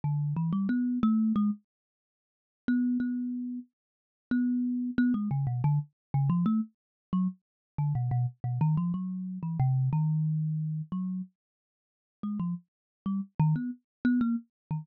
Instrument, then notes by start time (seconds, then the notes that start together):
kalimba
0.04 D3
0.36 E3
0.52 G3
0.69 B3
1.03 A3
1.36 G#3
2.68 B3
3.00 B3
4.31 B3
4.98 B3
5.14 G#3
5.31 C#3
5.47 B2
5.64 D3
6.14 C#3
6.30 F3
6.46 A3
7.13 F#3
7.78 D3
7.95 B2
8.11 B2
8.44 B2
8.61 D#3
8.77 F3
8.94 F#3
9.43 E3
9.59 C3
9.93 D#3
10.92 F#3
12.23 G#3
12.39 F3
13.06 G3
13.39 D#3
13.56 B3
14.05 B3
14.21 A#3
14.71 D#3